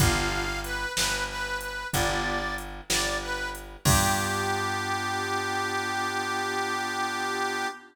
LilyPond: <<
  \new Staff \with { instrumentName = "Harmonica" } { \time 12/8 \key g \major \tempo 4. = 62 f''4 b'8 b'8 b'8 b'8 d''4 r8 d''8 b'8 r8 | g'1. | }
  \new Staff \with { instrumentName = "Drawbar Organ" } { \time 12/8 \key g \major <b d' f' g'>2. <b d' f' g'>2. | <b d' f' g'>1. | }
  \new Staff \with { instrumentName = "Electric Bass (finger)" } { \clef bass \time 12/8 \key g \major g,,4. g,,4. g,,4. g,,4. | g,1. | }
  \new DrumStaff \with { instrumentName = "Drums" } \drummode { \time 12/8 <hh bd>4 hh8 sn4 hh8 <hh bd>4 hh8 sn4 hh8 | <cymc bd>4. r4. r4. r4. | }
>>